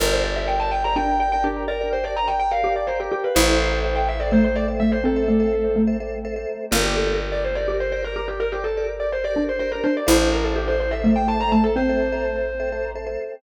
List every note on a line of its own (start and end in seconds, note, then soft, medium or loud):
0.00 3.09 G1 loud
0.00 0.08 G4 loud
0.00 0.08 A#4 loud
0.00 0.11 A#4 loud
0.00 0.93 A#4 medium
0.00 0.08 D5 medium
0.12 0.31 G4 medium
0.12 0.31 A#4 medium
0.12 0.23 C5 medium
0.12 0.31 D5 loud
0.24 0.36 D5 medium
0.36 0.76 G4 loud
0.36 0.76 A#4 medium
0.36 0.76 D5 medium
0.36 0.47 E5 medium
0.48 0.59 G5 medium
0.60 0.71 A5 medium
0.71 0.83 G5 medium
0.84 0.94 G4 loud
0.84 0.94 A#4 medium
0.84 0.94 D5 loud
0.84 0.96 A#5 medium
0.96 1.39 D4 medium
0.96 1.16 G4 medium
0.96 1.16 A#4 medium
0.96 1.16 D5 loud
0.96 1.19 G5 medium
1.19 1.29 G4 medium
1.19 1.29 A#4 medium
1.19 1.29 D5 loud
1.19 1.31 G5 medium
1.32 1.72 G4 medium
1.32 1.72 A#4 loud
1.32 1.72 D5 medium
1.32 1.44 G5 loud
1.44 1.67 D4 medium
1.44 1.64 G4 medium
1.68 1.89 A#4 loud
1.68 2.51 D5 medium
1.81 2.00 G4 medium
1.81 2.00 A#4 medium
1.81 2.00 D5 medium
1.93 2.04 C5 medium
2.04 2.42 G4 medium
2.04 2.42 A#4 medium
2.04 2.42 D5 loud
2.04 2.16 D5 medium
2.17 2.28 A#5 medium
2.28 2.39 G5 medium
2.40 2.51 G5 loud
2.51 2.61 G4 medium
2.51 2.61 A#4 loud
2.51 2.61 D5 medium
2.51 2.73 F5 medium
2.63 2.82 G4 loud
2.63 3.09 G4 medium
2.63 2.82 A#4 medium
2.63 2.82 D5 medium
2.76 2.87 D5 medium
2.87 2.98 G4 medium
2.87 2.98 A#4 medium
2.87 2.98 C5 medium
2.87 2.98 D5 medium
3.00 3.11 G4 medium
3.00 3.29 G4 medium
3.00 3.29 A#4 medium
3.00 3.29 D5 loud
3.12 3.23 G4 medium
3.12 3.34 G4 medium
3.24 3.35 B4 medium
3.35 6.45 A1 loud
3.35 4.27 E4 medium
3.35 3.45 A4 loud
3.35 3.78 C5 loud
3.35 3.45 C5 loud
3.35 3.45 E5 loud
3.48 3.68 A4 medium
3.48 3.68 C5 medium
3.48 3.68 E5 loud
3.72 4.10 A4 medium
3.72 4.10 C5 medium
3.72 4.10 E5 loud
3.84 3.95 C5 medium
3.96 4.07 G5 medium
4.08 4.20 E5 medium
4.20 4.29 A4 medium
4.20 4.29 C5 medium
4.20 4.32 D5 medium
4.20 4.29 E5 medium
4.31 4.72 A3 medium
4.31 4.50 A4 medium
4.31 4.50 C5 medium
4.31 4.44 C5 loud
4.31 4.50 E5 loud
4.44 4.56 C5 medium
4.56 4.66 A4 medium
4.56 4.66 C5 medium
4.56 4.67 D5 medium
4.56 4.66 E5 medium
4.68 5.06 A4 medium
4.68 5.06 C5 medium
4.68 5.06 E5 medium
4.80 5.00 A3 medium
4.80 4.91 E5 medium
4.92 5.03 C5 medium
5.04 5.24 C4 medium
5.04 5.82 A4 medium
5.16 5.35 A4 medium
5.16 5.35 C5 medium
5.16 5.35 E5 medium
5.28 5.68 A3 medium
5.40 5.78 A4 medium
5.40 5.78 C5 medium
5.40 5.78 E5 medium
5.76 5.96 A3 medium
5.87 5.97 A4 medium
5.87 5.97 C5 medium
5.87 5.97 E5 loud
6.00 6.19 A4 medium
6.00 6.19 C5 medium
6.00 6.19 E5 medium
6.25 6.34 A4 loud
6.25 6.34 C5 medium
6.25 6.34 E5 loud
6.36 6.65 A4 medium
6.36 6.65 C5 medium
6.36 6.65 E5 loud
6.71 9.81 G1 loud
6.71 7.57 A#3 medium
6.71 6.80 G4 loud
6.71 6.80 A#4 loud
6.71 6.84 A#4 medium
6.71 6.80 D5 loud
6.84 6.95 G4 medium
6.84 7.04 G4 loud
6.84 7.04 A#4 loud
6.84 7.04 D5 loud
6.96 7.18 A4 medium
7.07 7.45 G4 loud
7.07 7.45 A#4 loud
7.07 7.45 D5 loud
7.32 7.43 D5 medium
7.44 7.56 C5 medium
7.55 7.66 G4 loud
7.55 7.66 A#4 loud
7.55 7.77 D5 medium
7.55 7.66 D5 medium
7.68 8.07 G4 medium
7.68 7.88 G4 medium
7.68 7.88 A#4 loud
7.68 7.88 D5 medium
7.80 7.92 C5 medium
7.92 8.01 G4 loud
7.92 8.01 A#4 medium
7.92 8.04 C5 medium
7.92 8.01 D5 loud
8.02 8.41 G4 medium
8.02 8.41 A#4 medium
8.02 8.15 A#4 loud
8.02 8.41 D5 medium
8.16 8.37 G4 medium
8.16 8.27 A#4 loud
8.28 8.39 G4 medium
8.40 9.25 A#4 medium
8.40 8.52 A#4 loud
8.52 8.63 G4 loud
8.52 8.72 G4 loud
8.52 8.72 A#4 medium
8.52 8.72 D5 medium
8.64 8.85 A4 medium
8.77 9.16 G4 loud
8.77 9.16 A#4 loud
8.77 9.16 D5 loud
9.00 9.11 D5 medium
9.12 9.24 C5 medium
9.24 9.33 G4 loud
9.24 9.33 A#4 medium
9.24 9.33 D5 loud
9.24 9.44 D5 loud
9.34 9.81 D4 medium
9.34 9.54 G4 medium
9.34 9.54 A#4 medium
9.34 9.54 D5 medium
9.49 9.59 C5 medium
9.59 9.70 G4 loud
9.59 9.70 A#4 loud
9.59 9.71 C5 loud
9.59 9.70 D5 medium
9.72 10.00 G4 medium
9.72 9.83 A#4 medium
9.72 10.00 A#4 loud
9.72 10.00 D5 medium
9.84 10.07 D4 medium
9.84 9.95 C5 medium
9.97 10.08 D5 medium
10.07 13.17 A1 loud
10.07 10.93 E4 medium
10.07 10.16 A4 loud
10.07 10.16 C5 loud
10.07 10.29 C5 loud
10.07 10.16 E5 loud
10.21 10.40 A4 medium
10.21 10.40 C5 medium
10.21 10.40 E5 loud
10.32 10.44 A#4 medium
10.44 10.55 A4 medium
10.44 10.83 A4 loud
10.44 10.83 C5 loud
10.44 10.83 E5 medium
10.56 10.67 G4 medium
10.68 10.79 C5 loud
10.80 10.92 C5 medium
10.91 11.02 A4 loud
10.91 11.02 C5 loud
10.91 11.10 E5 medium
10.91 11.02 E5 medium
11.04 11.45 A3 medium
11.04 11.23 A4 medium
11.04 11.23 C5 loud
11.04 11.23 E5 loud
11.16 11.27 G5 medium
11.28 11.37 A4 loud
11.28 11.37 C5 medium
11.28 11.37 E5 medium
11.28 11.40 A5 medium
11.40 11.78 A4 loud
11.40 11.78 C5 medium
11.40 11.78 E5 loud
11.40 11.52 A#5 medium
11.52 11.74 A3 medium
11.52 11.63 A5 medium
11.64 11.75 A4 loud
11.76 12.20 C4 medium
11.76 12.90 C5 loud
11.89 12.08 A4 medium
11.89 12.08 C5 medium
11.89 12.08 E5 medium
12.12 12.51 A4 medium
12.12 12.51 C5 loud
12.12 12.51 E5 loud
12.60 12.69 A4 medium
12.60 12.69 C5 medium
12.60 12.69 E5 loud
12.72 12.91 A4 medium
12.72 12.91 C5 loud
12.72 12.91 E5 medium
12.95 13.05 A4 loud
12.95 13.05 C5 loud
12.95 13.05 E5 medium
13.06 13.35 A4 loud
13.06 13.35 C5 loud
13.06 13.35 E5 medium